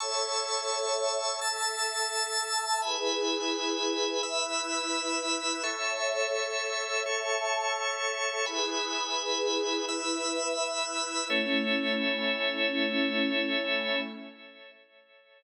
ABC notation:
X:1
M:4/4
L:1/8
Q:1/4=85
K:A
V:1 name="Pad 2 (warm)"
[Ace]4 [Aea]4 | [EGB]4 [EBe]4 | [Ace]4 [Aea]4 | [EGB]4 [EBe]4 |
[A,CE]8 |]
V:2 name="Drawbar Organ"
[ac'e']4 [ae'a']4 | [egb]4 [ebe']4 | [Aec']4 [Acc']4 | [egb]4 [ebe']4 |
[Ace]8 |]